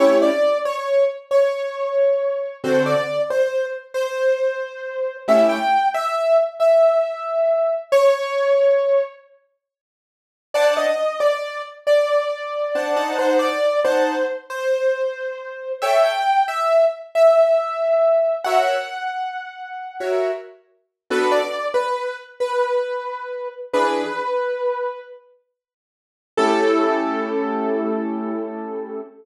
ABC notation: X:1
M:12/8
L:1/8
Q:3/8=91
K:A
V:1 name="Acoustic Grand Piano"
c d2 c2 z c6 | =c d2 c2 z c6 | e =g2 e2 z e6 | c6 z6 |
d _e2 d2 z d6 | =c d2 c2 z c6 | e =g2 e2 z e6 | f8 z4 |
B d2 B2 z B6 | B7 z5 | A12 |]
V:2 name="Acoustic Grand Piano"
[A,CE=G]12 | [D,=CFA]12 | [A,CE=G]12 | z12 |
[D=cfa]10 [Dcfa] [^Dcfa]- | [^D=cfa]3 [Dfa]9 | [Ac=g]12 | [F^Ace]7 [FAce]5 |
[B,DFA]12 | [E,DG]12 | [A,CE=G]12 |]